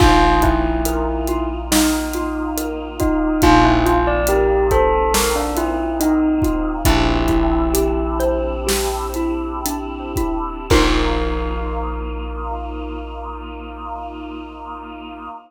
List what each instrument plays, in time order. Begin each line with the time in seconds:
0.00 electric bass (finger) A#1, choir aahs A#3 D#4 F4, xylophone D#4, tubular bells F4, kick, crash
0.42 tubular bells E4, xylophone F4, kick, closed hi-hat
0.85 xylophone A#4, closed hi-hat
1.28 xylophone F4, closed hi-hat
1.72 tubular bells D#4, xylophone D#4, snare
2.14 xylophone F4, closed hi-hat
2.57 xylophone A#4, closed hi-hat
3.00 tubular bells D#4, xylophone F4, kick, closed hi-hat
3.42 electric bass (finger) A#1, choir aahs A#3 C4 D#4 F4, xylophone D#4, tubular bells F4, kick, closed hi-hat
3.64 tubular bells E4
3.86 tubular bells F4, xylophone F4, closed hi-hat
4.07 tubular bells D5
4.27 tubular bells G4, xylophone A#4, closed hi-hat
4.71 tubular bells A4, xylophone C5, kick, closed hi-hat
5.14 tubular bells A#4, xylophone A#4, snare
5.36 tubular bells D4
5.57 tubular bells E4, xylophone F4, closed hi-hat
6.00 tubular bells D#4, xylophone D#4, closed hi-hat
6.42 xylophone F4, kick, closed hi-hat
6.85 electric bass (finger) A#1, choir aahs C4 D4 E4 G4, xylophone D4, tubular bells E4, kick, closed hi-hat
7.28 xylophone E4, kick, closed hi-hat
7.73 xylophone G4, closed hi-hat
8.19 xylophone C5, closed hi-hat
8.67 xylophone G4, snare
9.14 xylophone E4, closed hi-hat
9.66 xylophone D4, closed hi-hat
10.16 xylophone E4, kick, closed hi-hat
10.70 electric bass (finger) A#1, choir aahs A#3 D#4 F4, xylophone D#4 F4 A#4, tubular bells A#4, kick, crash